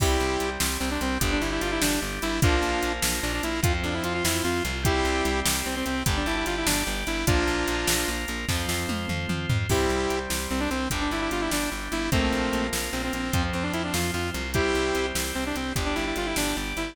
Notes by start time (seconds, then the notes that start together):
0.00 C2 G3 C4 E4 G4, kick, crash
0.20 C2
0.40 C2, closed hi-hat
0.60 C2, snare
0.80 C2 C4
0.91 D4
1.01 C2 C4, closed hi-hat
1.20 G1 G3 D4 G4, kick, closed hi-hat
1.32 D4
1.41 G1 E4
1.52 E4
1.61 G1 F4, closed hi-hat
1.72 E4
1.81 G1 D4, snare
2.02 G1
2.22 G1 E4, closed hi-hat
2.42 A#1 F3 A#3 D4 F4 A#4, kick, closed hi-hat
2.62 A#1
2.82 A#1, closed hi-hat
3.02 A#1, snare
3.23 A#1 D4
3.34 D4
3.43 A#1 E4, closed hi-hat
3.63 F2 F3 C4 F4 C5, kick, closed hi-hat
3.84 F2 D4
3.94 E4
4.04 F2 F4, closed hi-hat
4.14 F4
4.24 F2 E4, snare
4.44 F2 F4
4.65 C2, closed hi-hat
4.83 G3 C4 E4 G4 C5, kick, closed hi-hat
5.05 C2
5.25 C2, closed hi-hat
5.46 C2, snare
5.66 C2 C4
5.76 C4
5.86 C2 C4, closed hi-hat
6.06 G1 G3 D4 G4 D5, kick, closed hi-hat
6.17 D4
6.26 G1 E4
6.36 E4
6.46 G1 F4, closed hi-hat
6.57 E4
6.66 G1 D4, snare
6.87 G1
7.07 G1 E4, closed hi-hat
7.27 A#1 F3 A#3 D4 F4 A#4, kick, closed hi-hat
7.47 A#1
7.68 A#1, closed hi-hat
7.87 A#1, snare
8.08 A#1
8.28 A#1, closed hi-hat
8.49 F2 F3 C4 F4 C5, kick, snare
8.69 F2, snare
8.89 F2, high tom
9.09 F2, mid tom
9.29 F2, mid tom
9.49 F2, floor tom
9.69 C2 G3 C4 E4 G4, kick, crash
9.90 C2
10.10 C2, closed hi-hat
10.30 C2, snare
10.50 C2 C4
10.60 D4
10.70 C2 C4, closed hi-hat
10.90 G1 G3 D4 G4, kick, closed hi-hat
11.01 D4
11.11 G1 E4
11.21 E4
11.31 G1 F4, closed hi-hat
11.41 E4
11.51 G1 D4, snare
11.72 G1
11.92 G1 E4, closed hi-hat
12.12 A#1 F3 A3 A#3 C4 F4 A#4, kick, closed hi-hat
12.32 A#1
12.53 A#1, closed hi-hat
12.73 A#1, snare
12.93 A#1 C4
13.04 C4
13.13 A#1 C4, closed hi-hat
13.32 F2 F3 C4 F4 C5, kick, closed hi-hat
13.53 F2 C4
13.63 D4
13.73 F2 E4, closed hi-hat
13.84 D4
13.94 F2 F4, snare
14.14 F2 F4
14.34 C2, closed hi-hat
14.54 G3 C4 E4 G4 C5, kick, closed hi-hat
14.75 C2
14.95 C2, closed hi-hat
15.15 C2, snare
15.35 C2 C4
15.46 D4
15.55 C2 C4, closed hi-hat
15.76 G1 G3 D4 G4 D5, kick, closed hi-hat
15.86 D4
15.95 G1 E4
16.07 E4
16.16 G1 F4, closed hi-hat
16.26 E4
16.36 G1 D4, snare
16.56 G1
16.77 G1 E4, closed hi-hat